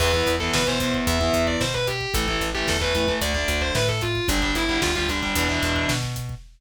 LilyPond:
<<
  \new Staff \with { instrumentName = "Distortion Guitar" } { \time 4/4 \key e \phrygian \tempo 4 = 112 b'8 r16 a'16 b'16 c''8 r16 e''8. d''16 c''16 b'16 g'8 | a'8 r16 g'16 a'16 b'8 r16 d''8. c''16 b'16 a'16 f'8 | d'16 d'16 e'8 f'16 f'16 d'4. r4 | }
  \new Staff \with { instrumentName = "Overdriven Guitar" } { \time 4/4 \key e \phrygian <e b>16 <e b>8 <e b>8 <e b>16 <e b>8. <e b>4.~ <e b>16 | <e a>16 <e a>8 <e a>8 <e a>16 <e a>16 <e a>16 <d a>16 <d a>4.~ <d a>16 | <d g>16 <d g>8 <d g>8 <d g>16 <d g>16 <d g>16 <b, e>16 <b, e>4.~ <b, e>16 | }
  \new Staff \with { instrumentName = "Electric Bass (finger)" } { \clef bass \time 4/4 \key e \phrygian e,8 e,8 b,4 e,8 e,8 b,4 | a,,8 a,,8 e,4 d,8 d,8 a,4 | g,,8 g,,8 d,4 e,8 e,8 b,4 | }
  \new DrumStaff \with { instrumentName = "Drums" } \drummode { \time 4/4 <cymc bd>16 bd16 <hh bd>16 bd16 <bd sn>16 bd16 <hh bd>16 bd16 <hh bd>16 bd16 <hh bd>16 bd16 <bd sn>16 bd16 <hh bd>16 bd16 | <hh bd>16 bd16 <hh bd>16 bd16 <bd sn>16 bd16 <hh bd>16 bd16 <hh bd>16 bd16 <hh bd>16 bd16 <bd sn>16 bd16 <hh bd>16 bd16 | <hh bd>16 bd16 <hh bd>16 bd16 <bd sn>16 bd16 <hh bd>16 bd16 <hh bd>16 bd16 <hh bd>16 bd16 <bd sn>16 bd16 <hh bd>16 bd16 | }
>>